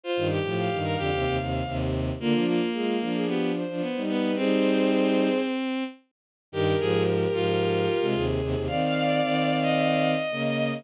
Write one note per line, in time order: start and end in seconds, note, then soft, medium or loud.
0.03 0.28 F4 medium
0.03 0.28 C5 loud
0.16 0.39 G2 medium
0.16 0.39 D#3 medium
0.30 0.78 G4 medium
0.43 0.68 A2 medium
0.43 0.68 F3 medium
0.58 1.74 F5 medium
0.72 0.96 G2 medium
0.72 0.96 D#3 medium
0.84 0.96 A#4 medium
0.97 1.10 F2 medium
0.97 1.10 D3 medium
0.97 1.37 G4 medium
1.13 1.25 D#2 medium
1.13 1.25 C3 medium
1.25 1.38 D#2 medium
1.25 1.38 C3 medium
1.39 1.62 D#2 medium
1.39 1.62 C3 medium
1.66 2.11 D#2 medium
1.66 2.11 C3 medium
2.20 2.33 D3 medium
2.20 2.33 A#3 medium
2.20 2.45 A#3 medium
2.20 2.46 F4 loud
2.34 2.60 F3 medium
2.34 2.60 D4 medium
2.47 3.26 A#3 medium
2.47 2.69 F4 loud
2.73 2.98 G#3 medium
2.73 2.98 F4 medium
2.73 2.96 G#4 medium
3.00 3.64 F3 medium
3.00 3.64 D4 medium
3.00 3.14 F4 medium
3.14 3.27 G#4 loud
3.27 3.52 B3 medium
3.27 3.51 G4 loud
3.55 4.01 C5 medium
3.68 3.81 F3 medium
3.68 3.81 D4 medium
3.81 4.02 B3 medium
3.96 4.36 G3 medium
3.96 4.36 D#4 medium
4.08 4.31 B3 medium
4.08 4.35 B4 loud
4.35 5.29 G3 medium
4.35 5.84 C4 medium
4.35 5.29 D#4 medium
4.35 5.41 G#4 loud
4.35 5.41 C5 loud
6.52 6.74 G2 medium
6.52 6.74 D#3 medium
6.52 8.06 G4 loud
6.52 6.76 G4 medium
6.52 8.06 A#4 loud
6.80 7.26 G#2 medium
6.80 7.26 F3 medium
6.80 7.03 G#4 medium
7.33 7.88 G#2 medium
7.33 7.88 F3 medium
7.33 8.24 F4 medium
8.01 8.14 C3 medium
8.01 8.14 G#3 medium
8.14 8.40 D#2 medium
8.14 8.40 C3 medium
8.14 8.63 G#4 loud
8.41 8.54 D#2 medium
8.41 8.54 C3 medium
8.55 8.67 D#2 medium
8.55 8.67 C3 medium
8.67 9.21 D#3 medium
8.67 9.21 C4 medium
8.67 10.11 D5 loud
8.67 8.84 F5 medium
8.67 10.11 F5 loud
8.86 9.03 F5 medium
9.04 9.21 D5 medium
9.23 10.15 D#3 medium
9.23 10.15 C4 medium
9.23 9.56 D5 medium
9.62 10.74 D#5 medium
10.31 10.82 C#3 medium
10.31 10.82 A#3 medium
10.31 10.80 D#5 loud